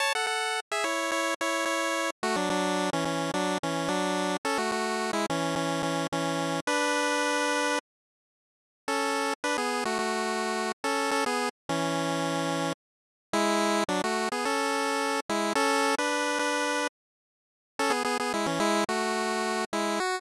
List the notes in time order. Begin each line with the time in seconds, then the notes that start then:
0.00 C#5 A5
0.15 A4 F#5
0.27 A4 F#5
0.72 G#4 E5
0.84 E4 C#5
1.12 E4 C#5
1.41 E4 C#5
1.66 E4 C#5
2.23 A3 F#4
2.36 F#3 D4
2.50 F#3 D4
2.93 E3 C#4
3.05 E3 C#4
3.34 F#3 D4
3.63 E3 C#4
3.88 F#3 D4
4.45 C#4 A4
4.58 A3 F#4
4.72 A3 F#4
5.13 G#3 E4
5.30 E3 C#4
5.56 E3 C#4
5.83 E3 C#4
6.12 E3 C#4
6.67 D4 B4
8.88 C#4 A4
9.44 D4 B4
9.58 B3 G#4
9.85 A3 F#4
9.99 A3 F#4
10.84 C#4 A4
11.11 C#4 A4
11.26 B3 G#4
11.69 E3 C#4
13.33 G#3 E4
13.89 F#3 D4
14.04 A3 F#4
14.32 B3 G#4
14.45 C#4 A4
15.29 G#3 E4
15.55 C#4 A4
15.98 D4 B4
16.39 D4 B4
17.79 C#4 A4
17.90 B3 G#4
18.05 B3 G#4
18.20 B3 G#4
18.34 G#3 E4
18.46 E3 C#4
18.60 G#3 E4
18.89 A3 F#4
19.73 G#3 E4
20.00 F#4